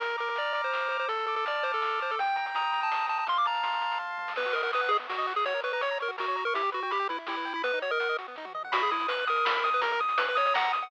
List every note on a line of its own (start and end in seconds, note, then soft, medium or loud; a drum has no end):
0.00 0.15 A#1 medium
0.00 0.16 A#4 loud
0.00 0.72 A#5 loud
0.00 kick medium
0.00 closed hi-hat medium
0.10 closed hi-hat medium
0.18 0.33 A#1 medium
0.18 0.29 A#4 medium
0.18 0.53 D6 medium
0.18 closed hi-hat medium
0.27 0.38 A#4 medium
0.27 closed hi-hat medium
0.36 0.53 A#1 medium
0.36 0.52 D5 medium
0.36 1.05 F6 medium
0.36 closed hi-hat medium
0.45 closed hi-hat medium
0.53 0.69 A#1 medium
0.53 0.62 D5 medium
0.53 0.91 D6 medium
0.53 closed hi-hat medium
0.64 0.88 C5 medium
0.64 closed hi-hat medium
0.72 0.87 A#1 medium
0.72 1.07 A#5 medium
0.72 snare medium
0.82 closed hi-hat medium
0.89 1.24 D2 medium
0.89 0.97 C5 medium
0.89 1.09 D6 medium
0.89 closed hi-hat medium
0.99 1.08 C5 medium
0.99 closed hi-hat soft
1.08 1.26 A4 loud
1.08 1.81 A5 loud
1.08 kick medium
1.08 closed hi-hat medium
1.19 closed hi-hat medium
1.26 1.42 D2 medium
1.26 1.35 A4 medium
1.26 1.63 D6 medium
1.26 closed hi-hat soft
1.36 1.45 A4 medium
1.36 closed hi-hat medium
1.45 1.60 D2 medium
1.45 1.64 D5 medium
1.45 2.15 F6 medium
1.45 closed hi-hat medium
1.55 closed hi-hat soft
1.63 1.79 D2 medium
1.63 1.72 C5 medium
1.63 2.01 D6 medium
1.63 closed hi-hat medium
1.72 2.00 A4 medium
1.72 closed hi-hat medium
1.82 1.99 D2 medium
1.82 2.16 A5 medium
1.82 snare medium
1.90 closed hi-hat medium
2.00 2.17 D2 medium
2.00 2.11 C5 medium
2.00 2.18 D6 medium
2.00 closed hi-hat medium
2.10 2.20 A4 medium
2.10 closed hi-hat medium
2.19 2.34 D#2 medium
2.19 2.90 G5 loud
2.19 2.37 G5 loud
2.19 kick medium
2.19 closed hi-hat medium
2.27 closed hi-hat medium
2.36 2.52 D#2 medium
2.36 2.46 G5 medium
2.36 2.73 A#5 medium
2.36 closed hi-hat medium
2.46 2.55 G5 medium
2.46 closed hi-hat medium
2.55 2.70 D#2 medium
2.55 2.72 A#5 medium
2.55 3.24 D#6 medium
2.55 closed hi-hat medium
2.64 closed hi-hat soft
2.72 2.88 D#2 medium
2.72 2.81 A#5 medium
2.72 3.09 A#5 medium
2.72 closed hi-hat medium
2.81 3.06 A5 loud
2.81 closed hi-hat medium
2.90 3.05 D#2 medium
2.90 3.25 G5 medium
2.90 snare medium
3.00 closed hi-hat soft
3.08 3.24 D#2 medium
3.08 3.18 A5 loud
3.08 3.26 A#5 medium
3.08 closed hi-hat medium
3.17 3.28 A5 medium
3.17 closed hi-hat soft
3.27 3.44 F2 medium
3.27 3.98 F5 medium
3.27 3.38 C6 loud
3.27 kick medium
3.27 closed hi-hat medium
3.37 3.47 D6 medium
3.37 closed hi-hat medium
3.45 3.61 F2 medium
3.45 3.81 A5 medium
3.45 3.98 A#5 medium
3.45 closed hi-hat medium
3.54 closed hi-hat medium
3.63 3.79 F2 medium
3.63 4.32 C6 medium
3.63 closed hi-hat medium
3.73 closed hi-hat medium
3.81 3.96 F2 medium
3.81 4.18 A5 medium
3.81 closed hi-hat medium
3.91 closed hi-hat medium
3.99 4.15 F2 medium
3.99 4.34 F5 medium
3.99 kick medium
3.99 floor tom medium
4.09 mid tom medium
4.18 4.34 F2 medium
4.18 4.36 A5 medium
4.18 high tom medium
4.28 snare medium
4.36 4.46 B3 loud
4.36 4.55 B4 loud
4.36 kick medium
4.36 crash medium
4.45 4.54 F#4 medium
4.53 4.62 A#4 loud
4.53 4.63 D#5 medium
4.53 closed hi-hat medium
4.63 4.72 A#4 loud
4.63 4.71 F#5 medium
4.73 4.91 B4 loud
4.73 4.81 D#6 loud
4.73 closed hi-hat medium
4.81 4.89 F#5 medium
4.89 4.97 G#4 loud
4.89 4.99 D#5 medium
4.89 closed hi-hat medium
4.99 5.07 B3 medium
5.09 5.17 F#4 medium
5.09 5.33 F#4 medium
5.09 snare medium
5.18 5.26 D#5 loud
5.27 5.35 F#5 medium
5.27 open hi-hat medium
5.36 5.45 G#4 loud
5.36 5.45 D#6 medium
5.45 5.54 F#4 loud
5.45 5.60 C#5 loud
5.45 kick medium
5.45 closed hi-hat medium
5.54 5.62 A#4 medium
5.63 5.72 B4 loud
5.63 5.72 C#5 medium
5.63 closed hi-hat medium
5.73 5.81 B4 loud
5.73 5.81 A#5 loud
5.81 5.98 C#5 loud
5.81 5.89 C#6 medium
5.81 closed hi-hat medium
5.91 5.99 A#5 medium
5.99 6.11 A#4 loud
5.99 6.08 C#5 medium
5.99 closed hi-hat medium
6.08 6.17 F#4 medium
6.18 6.44 F#4 loud
6.18 6.26 A#4 loud
6.18 snare medium
6.28 6.36 C#5 loud
6.35 6.44 A#5 medium
6.35 closed hi-hat medium
6.45 6.54 A#4 loud
6.45 6.55 C#6 medium
6.54 6.62 E4 loud
6.54 6.70 G4 loud
6.54 kick medium
6.54 closed hi-hat medium
6.63 6.71 G4 medium
6.72 6.83 F#4 loud
6.72 6.80 B4 medium
6.72 closed hi-hat medium
6.83 6.92 F#4 loud
6.83 6.91 G5 medium
6.91 7.08 G4 loud
6.91 6.99 B5 loud
6.91 closed hi-hat medium
7.00 7.08 G5 medium
7.09 7.19 E4 loud
7.09 7.17 B4 loud
7.09 closed hi-hat medium
7.18 7.27 E4 medium
7.27 7.53 E4 loud
7.27 7.36 G4 loud
7.27 snare medium
7.37 7.45 B4 medium
7.45 7.53 G5 medium
7.45 closed hi-hat medium
7.54 7.62 E4 loud
7.54 7.64 B5 loud
7.63 7.72 B3 loud
7.63 7.79 B4 loud
7.63 kick medium
7.63 closed hi-hat medium
7.73 7.82 D#4 loud
7.82 7.91 F#4 medium
7.82 7.91 C#5 loud
7.82 closed hi-hat medium
7.91 8.17 A#4 loud
7.91 7.99 D#5 medium
8.00 8.08 F#5 medium
8.00 closed hi-hat medium
8.09 8.17 D#5 medium
8.18 8.27 F#4 medium
8.18 closed hi-hat medium
8.28 8.36 B3 medium
8.36 8.46 D#4 loud
8.36 kick medium
8.36 snare medium
8.45 8.53 F#4 medium
8.45 high tom medium
8.55 8.63 D#5 medium
8.55 mid tom medium
8.63 8.73 F#5 medium
8.63 floor tom loud
8.72 8.89 B1 loud
8.72 8.82 F#4 loud
8.72 8.90 B5 loud
8.72 kick loud
8.72 closed hi-hat loud
8.81 8.91 G#4 loud
8.81 closed hi-hat medium
8.91 9.06 B1 medium
8.91 9.07 E4 loud
8.91 9.09 D#6 loud
8.91 closed hi-hat medium
9.00 closed hi-hat medium
9.08 9.26 B1 medium
9.08 9.25 B4 loud
9.08 9.28 F#6 loud
9.08 closed hi-hat loud
9.18 closed hi-hat medium
9.26 9.42 B1 medium
9.26 9.70 A#4 loud
9.26 9.45 D#6 loud
9.26 closed hi-hat medium
9.36 closed hi-hat medium
9.44 9.60 B1 medium
9.44 9.63 B5 loud
9.44 snare loud
9.55 closed hi-hat medium
9.64 9.97 D#2 loud
9.64 9.81 D#6 loud
9.64 closed hi-hat medium
9.73 9.83 B4 loud
9.73 closed hi-hat medium
9.82 9.92 A#4 loud
9.82 10.00 A#5 loud
9.82 kick loud
9.82 closed hi-hat loud
9.91 10.01 A#4 loud
9.91 closed hi-hat medium
10.00 10.16 D#2 medium
10.00 10.18 D#6 loud
10.00 closed hi-hat medium
10.09 closed hi-hat medium
10.18 10.35 D#2 medium
10.18 10.26 B4 loud
10.18 10.36 F#6 loud
10.18 closed hi-hat loud
10.28 10.37 B4 loud
10.28 closed hi-hat medium
10.35 10.52 D#2 medium
10.35 10.46 C#5 loud
10.35 10.53 D#6 loud
10.35 closed hi-hat medium
10.46 10.55 C#5 loud
10.46 closed hi-hat medium
10.54 10.72 D#2 loud
10.54 10.72 F#5 loud
10.54 10.72 A#5 loud
10.54 snare loud
10.64 closed hi-hat medium
10.73 10.88 D#2 medium
10.73 10.90 D#6 loud
10.73 closed hi-hat medium
10.81 10.90 F#5 loud
10.81 closed hi-hat medium